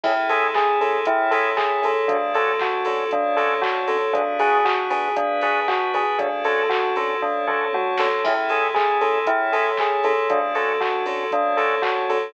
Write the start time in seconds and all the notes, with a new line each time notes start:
0.04 A1 C#4 E4 G#4 A4, kick, crash
0.29 C#4 E4 G#4 A4, open hi-hat
0.54 G#4, kick, clap
0.80 C#4 E4 G#4 A4, open hi-hat
1.05 A1 C#4 E4 A4 C#5, kick, closed hi-hat
1.31 C#4 E4 G#4 A4, open hi-hat
1.57 G#4, kick, clap
1.82 C#4 E4 G#4 A4, open hi-hat
2.07 D2 C#4 D4 F#4 A4, kick, closed hi-hat
2.34 C#4 D4 F#4 A4, open hi-hat
2.59 F#4, kick, clap
2.85 C#4 D4 F#4 A4, open hi-hat
3.11 D2 C#4 D4 A4 C#5, kick, closed hi-hat
3.36 C#4 D4 F#4 A4, open hi-hat
3.62 F#4, kick, clap
3.88 C#4 D4 F#4 A4, open hi-hat
4.13 G#1 B3 D4 F#4 G#4, kick, closed hi-hat
4.39 B3 D4 F#4 G#4, open hi-hat
4.65 F#4, kick, clap
4.90 B3 D4 F#4 G#4, open hi-hat
5.16 G#1 B3 D4 G#4 B4, kick, closed hi-hat
5.41 B3 D4 F#4 G#4, open hi-hat
5.68 F#4, kick, clap
5.94 B3 D4 F#4 G#4, open hi-hat
6.18 D2 C#4 D4 F#4 A4, kick, closed hi-hat
6.44 C#4 D4 F#4 A4, open hi-hat
6.69 F#4, kick, clap
6.96 C#4 D4 F#4 A4, open hi-hat
7.21 D2 C#4 D4 A4 C#5, kick, floor tom
7.47 C#4 D4 F#4 A4, mid tom
7.73 F#4, high tom
7.98 C#4 D4 F#4 A4, snare
8.24 A1 C#4 E4 G#4 A4, kick, crash
8.49 C#4 E4 G#4 A4, open hi-hat
8.74 G#4, kick, clap
9.01 C#4 E4 G#4 A4, open hi-hat
9.26 A1 C#4 E4 A4 C#5, kick, closed hi-hat
9.52 C#4 E4 G#4 A4, open hi-hat
9.77 G#4, kick, clap
10.04 C#4 E4 G#4 A4, open hi-hat
10.29 D2 C#4 D4 F#4 A4, kick, closed hi-hat
10.55 C#4 D4 F#4 A4, open hi-hat
10.81 F#4, kick, clap
11.06 C#4 D4 F#4 A4, open hi-hat
11.31 D2 C#4 D4 A4 C#5, kick, closed hi-hat
11.57 C#4 D4 F#4 A4, open hi-hat
11.82 F#4, kick, clap
12.09 C#4 D4 F#4 A4, open hi-hat